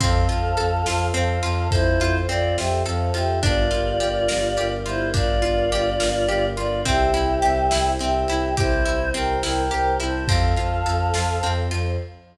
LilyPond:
<<
  \new Staff \with { instrumentName = "Choir Aahs" } { \time 6/8 \key f \major \tempo 4. = 70 <a' f''>2 <a' f''>4 | <e' c''>4 <f' d''>8 <g' e''>8 <a' f''>8 <g' e''>8 | <f' d''>2~ <f' d''>8 <e' c''>8 | <f' d''>2~ <f' d''>8 <f' d''>8 |
<g' e''>2 <g' e''>4 | <e' c''>4 <bes' g''>8 <bes' g''>8 <bes' g''>8 <c'' a''>8 | <a' f''>2~ <a' f''>8 r8 | }
  \new Staff \with { instrumentName = "Orchestral Harp" } { \time 6/8 \key f \major c'8 f'8 a'8 f'8 c'8 f'8 | a'8 f'8 c'8 f'8 a'8 f'8 | d'8 f'8 g'8 bes'8 g'8 f'8 | d'8 f'8 g'8 bes'8 g'8 f'8 |
c'8 e'8 g'8 e'8 c'8 e'8 | g'8 e'8 c'8 e'8 g'8 e'8 | c'8 f'8 a'8 f'8 c'8 f'8 | }
  \new Staff \with { instrumentName = "Violin" } { \clef bass \time 6/8 \key f \major f,8 f,8 f,8 f,8 f,8 f,8 | f,8 f,8 f,8 f,8 f,8 f,8 | g,,8 g,,8 g,,8 g,,8 g,,8 g,,8 | g,,8 g,,8 g,,8 g,,8 g,,8 g,,8 |
c,8 c,8 c,8 c,8 c,8 c,8 | c,8 c,8 c,8 c,8 c,8 c,8 | f,8 f,8 f,8 f,8 f,8 f,8 | }
  \new Staff \with { instrumentName = "Choir Aahs" } { \time 6/8 \key f \major <c' f' a'>2. | <c' a' c''>2. | <d' f' g' bes'>2. | <d' f' bes' d''>2. |
<c' e' g'>2. | <c' g' c''>2. | <c' f' a'>4. <c' a' c''>4. | }
  \new DrumStaff \with { instrumentName = "Drums" } \drummode { \time 6/8 <bd cymr>8 cymr8 cymr8 sn8 cymr8 cymr8 | <bd cymr>8 cymr8 cymr8 sn8 cymr8 cymr8 | <bd cymr>8 cymr8 cymr8 sn8 cymr8 cymr8 | <bd cymr>8 cymr8 cymr8 sn8 cymr8 cymr8 |
<bd cymr>8 cymr8 cymr8 sn8 cymr8 cymr8 | <bd cymr>8 cymr8 cymr8 sn8 cymr8 cymr8 | <bd cymr>8 cymr8 cymr8 sn8 cymr8 cymr8 | }
>>